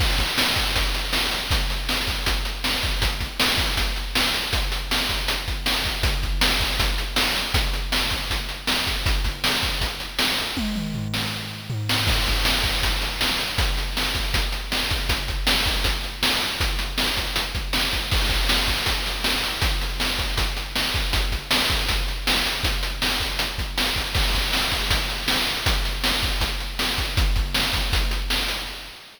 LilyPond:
\new DrumStaff \drummode { \time 4/4 \tempo 4 = 159 <cymc bd>8 <hh bd>8 sn8 <hh bd>8 <hh bd>8 hh8 sn8 hh8 | <hh bd>8 hh8 sn8 <hh bd>8 <hh bd>8 hh8 sn8 <hh bd>8 | <hh bd>8 <hh bd>8 sn8 <hh bd>8 <hh bd>8 hh8 sn8 hh8 | <hh bd>8 hh8 sn8 <hh bd>8 hh8 <hh bd>8 sn8 <hh bd>8 |
<hh bd>8 <hh bd>8 sn8 <hh bd>8 <hh bd>8 hh8 sn8 hh8 | <hh bd>8 hh8 sn8 <hh bd>8 <hh bd>8 hh8 sn8 <hh bd>8 | <hh bd>8 <hh bd>8 sn8 <hh bd>8 <hh bd>8 hh8 sn8 hh8 | <bd tommh>8 toml8 tomfh8 sn8 r4 tomfh8 sn8 |
<cymc bd>8 <hh bd>8 sn8 <hh bd>8 <hh bd>8 hh8 sn8 hh8 | <hh bd>8 hh8 sn8 <hh bd>8 <hh bd>8 hh8 sn8 <hh bd>8 | <hh bd>8 <hh bd>8 sn8 <hh bd>8 <hh bd>8 hh8 sn8 hh8 | <hh bd>8 hh8 sn8 <hh bd>8 hh8 <hh bd>8 sn8 <hh bd>8 |
<cymc bd>8 <hh bd>8 sn8 <hh bd>8 <hh bd>8 hh8 sn8 hh8 | <hh bd>8 hh8 sn8 <hh bd>8 <hh bd>8 hh8 sn8 <hh bd>8 | <hh bd>8 <hh bd>8 sn8 <hh bd>8 <hh bd>8 hh8 sn8 hh8 | <hh bd>8 hh8 sn8 <hh bd>8 hh8 <hh bd>8 sn8 <hh bd>8 |
<cymc bd>8 <hh bd>8 sn8 <hh bd>8 <hh bd>8 hh8 sn8 hh8 | <hh bd>8 hh8 sn8 <hh bd>8 <hh bd>8 hh8 sn8 <hh bd>8 | <hh bd>8 <hh bd>8 sn8 <hh bd>8 <hh bd>8 hh8 sn8 hh8 | }